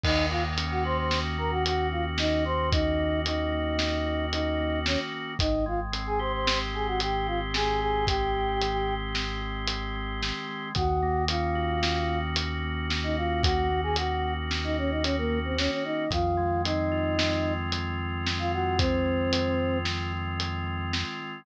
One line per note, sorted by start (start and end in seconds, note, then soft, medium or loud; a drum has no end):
0.04 4.97 D#2 loud
0.04 1.64 D#3 medium
0.04 0.26 D#4 medium
0.04 0.26 D#5 medium
0.04 kick loud
0.04 crash loud
0.30 1.37 A#3 medium
0.30 0.43 F4 medium
0.30 0.43 F5 medium
0.58 1.10 C#4 medium
0.58 closed hi-hat loud
0.71 0.83 F#4 medium
0.71 0.83 F#5 medium
0.84 2.44 F#4 medium
0.84 0.97 C5 medium
0.84 0.97 C6 medium
0.98 1.19 C5 medium
0.98 1.19 C6 medium
1.10 2.19 C#4 medium
1.10 snare loud
1.38 1.92 A#3 medium
1.38 1.51 A#4 medium
1.38 1.51 A#5 medium
1.51 1.64 F#4 medium
1.51 1.64 F#5 medium
1.65 3.25 D#3 medium
1.65 1.88 F#4 medium
1.65 1.88 F#5 medium
1.65 closed hi-hat loud
1.92 2.99 A#3 medium
1.92 2.04 F4 medium
1.92 2.04 F5 medium
2.18 2.71 C#4 medium
2.18 2.44 D#4 medium
2.18 2.44 D#5 medium
2.18 snare loud
2.45 4.06 F#4 medium
2.45 2.69 C5 medium
2.45 2.69 C6 medium
2.72 3.78 C#4 medium
2.72 3.20 D#4 medium
2.72 3.20 D#5 medium
2.72 kick loud
2.72 closed hi-hat loud
2.99 3.52 A#3 medium
3.25 4.86 D#3 medium
3.25 4.26 D#4 medium
3.25 4.26 D#5 medium
3.25 closed hi-hat loud
3.52 4.59 A#3 medium
3.79 4.32 C#4 medium
3.79 snare loud
4.06 5.34 F#4 medium
4.32 5.34 C#4 medium
4.32 4.79 D#4 medium
4.32 4.79 D#5 medium
4.32 closed hi-hat loud
4.60 5.12 A#3 medium
4.86 5.37 D#3 medium
4.86 4.99 C#4 medium
4.86 4.99 C#5 medium
4.86 snare loud
5.12 5.38 A#3 medium
5.39 10.32 G#1 medium
5.39 7.00 D#3 medium
5.39 5.65 D#4 medium
5.39 5.65 D#5 medium
5.39 kick loud
5.39 closed hi-hat loud
5.66 6.73 G#3 medium
5.66 5.80 F4 medium
5.66 5.80 F5 medium
5.92 6.47 C4 medium
5.92 closed hi-hat loud
6.07 6.19 G#4 medium
6.07 6.19 G#5 medium
6.19 7.81 G4 medium
6.19 6.32 C5 medium
6.19 6.32 C6 medium
6.33 6.59 C5 medium
6.33 6.59 C6 medium
6.47 7.53 C4 medium
6.47 snare loud
6.73 7.28 G#3 medium
6.73 6.87 G#4 medium
6.73 6.87 G#5 medium
6.87 7.00 F#4 medium
6.87 7.00 F#5 medium
7.00 8.60 D#3 medium
7.00 7.27 G4 medium
7.00 7.27 G5 medium
7.00 closed hi-hat loud
7.27 8.34 G#3 medium
7.27 7.40 F4 medium
7.27 7.40 F5 medium
7.54 8.08 C4 medium
7.54 7.80 G#4 medium
7.54 7.80 G#5 medium
7.54 snare loud
7.80 9.41 G4 medium
7.80 8.05 G#4 medium
7.80 8.05 G#5 medium
8.07 9.15 C4 medium
8.07 8.94 G4 medium
8.07 8.94 G5 medium
8.07 kick loud
8.07 closed hi-hat loud
8.35 8.88 G#3 medium
8.61 10.21 D#3 medium
8.61 closed hi-hat loud
8.89 9.95 G#3 medium
9.15 9.69 C4 medium
9.15 snare loud
9.42 10.69 G4 medium
9.68 10.71 C4 medium
9.68 closed hi-hat loud
9.96 10.48 G#3 medium
10.22 10.73 D#3 medium
10.22 snare loud
10.48 10.74 G#3 medium
10.75 15.69 D#2 loud
10.75 12.36 D#3 medium
10.75 11.24 F#4 medium
10.75 11.24 F#5 medium
10.75 kick loud
10.75 closed hi-hat loud
11.02 12.09 A#3 medium
11.28 11.82 C#4 medium
11.28 12.20 F4 medium
11.28 12.20 F5 medium
11.28 closed hi-hat loud
11.55 13.16 F#4 medium
11.82 12.89 C#4 medium
11.82 snare loud
12.10 12.63 A#3 medium
12.36 13.97 D#3 medium
12.36 closed hi-hat loud
12.64 13.70 A#3 medium
12.89 13.43 C#4 medium
12.89 snare loud
13.03 13.16 D#4 medium
13.03 13.16 D#5 medium
13.17 13.42 F4 medium
13.17 14.77 F#4 medium
13.17 13.42 F5 medium
13.43 14.49 C#4 medium
13.43 13.81 F#4 medium
13.43 13.81 F#5 medium
13.43 kick loud
13.43 closed hi-hat loud
13.70 14.22 A#3 medium
13.83 13.96 G#4 medium
13.83 13.96 G#5 medium
13.96 15.56 D#3 medium
13.96 14.33 F#4 medium
13.96 14.33 F#5 medium
13.96 closed hi-hat loud
14.23 15.30 A#3 medium
14.50 15.03 C#4 medium
14.50 snare loud
14.64 14.77 D#4 medium
14.64 14.77 D#5 medium
14.77 14.91 C#4 medium
14.77 16.04 F#4 medium
14.77 14.91 C#5 medium
14.91 15.03 D#4 medium
14.91 15.03 D#5 medium
15.03 15.16 C#4 medium
15.03 16.06 C#4 medium
15.03 15.16 C#5 medium
15.03 closed hi-hat loud
15.18 15.39 A#3 medium
15.18 15.39 A#4 medium
15.30 15.85 A#3 medium
15.45 15.57 C4 medium
15.45 15.57 C5 medium
15.57 16.08 D#3 medium
15.57 15.71 C#4 medium
15.57 15.71 C#5 medium
15.57 snare loud
15.71 15.84 C#4 medium
15.71 15.84 C#5 medium
15.84 16.11 A#3 medium
15.84 16.10 D#4 medium
15.84 16.10 D#5 medium
16.10 21.04 F2 loud
16.10 17.72 D#3 medium
16.10 16.62 F4 medium
16.10 16.62 F5 medium
16.10 kick loud
16.10 closed hi-hat loud
16.37 17.44 G#3 medium
16.64 17.17 C4 medium
16.64 17.53 D#4 medium
16.64 17.53 D#5 medium
16.64 closed hi-hat loud
16.92 18.51 F4 medium
17.18 18.25 C4 medium
17.18 snare loud
17.45 17.98 G#3 medium
17.72 19.32 D#3 medium
17.72 closed hi-hat loud
17.98 19.05 G#3 medium
18.26 18.78 C4 medium
18.26 snare loud
18.39 18.52 F4 medium
18.39 18.52 F5 medium
18.52 20.13 F4 medium
18.52 18.78 F#4 medium
18.52 18.78 F#5 medium
18.79 19.78 C4 medium
18.79 19.86 C4 medium
18.79 19.78 C5 medium
18.79 kick loud
18.79 closed hi-hat loud
19.06 19.59 G#3 medium
19.32 20.93 D#3 medium
19.32 closed hi-hat loud
19.59 20.66 G#3 medium
19.85 20.40 C4 medium
19.85 snare loud
20.13 21.40 F4 medium
20.40 21.42 C4 medium
20.40 closed hi-hat loud
20.66 21.20 G#3 medium
20.93 21.45 D#3 medium
20.93 snare loud
21.20 21.45 G#3 medium